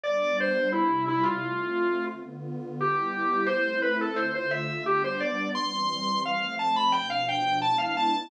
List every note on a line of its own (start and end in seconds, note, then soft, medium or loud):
0.03 0.72 G3 medium
0.03 0.73 B3 medium
0.03 0.73 D4 medium
0.03 0.37 D5 medium
0.40 0.68 C5 medium
0.72 1.41 C3 medium
0.72 1.41 G3 medium
0.72 1.05 E4 medium
0.72 1.41 E4 medium
1.08 1.24 E4 medium
1.23 2.05 F4 medium
1.41 2.10 A3 medium
1.41 2.10 C4 medium
1.41 2.10 F4 medium
2.11 2.79 D3 medium
2.11 2.79 B3 medium
2.11 2.79 F4 medium
2.80 3.49 G3 medium
2.80 3.49 B3 medium
2.80 3.48 E4 medium
2.80 3.47 G4 medium
3.46 4.17 A3 loud
3.46 4.17 C4 medium
3.46 4.17 E4 medium
3.46 3.79 C5 medium
3.82 3.98 B4 medium
4.01 4.17 A4 medium
4.16 4.85 D3 medium
4.16 4.85 A3 medium
4.16 4.85 F4 medium
4.16 4.32 C5 medium
4.35 4.51 C5 medium
4.51 4.83 E5 medium
4.86 5.55 G3 medium
4.86 5.55 B3 medium
4.86 5.55 D4 medium
4.86 5.02 G4 medium
5.04 5.20 C5 medium
5.20 5.49 D5 medium
5.55 6.23 E3 medium
5.55 6.23 G3 medium
5.55 6.23 C4 medium
5.55 6.21 C6 medium
6.25 6.93 F3 medium
6.25 6.94 A3 medium
6.25 6.94 C4 medium
6.25 6.55 F5 medium
6.59 6.75 A5 medium
6.76 6.93 B5 medium
6.92 7.62 B2 loud
6.92 7.62 F3 medium
6.92 7.62 D4 medium
6.92 7.08 G5 medium
7.10 7.26 F5 medium
7.28 7.59 G5 medium
7.62 8.30 G#3 medium
7.62 8.30 B3 medium
7.62 8.30 D4 medium
7.62 8.30 E4 medium
7.62 7.78 A5 medium
7.78 7.94 F5 medium
7.97 8.29 A5 medium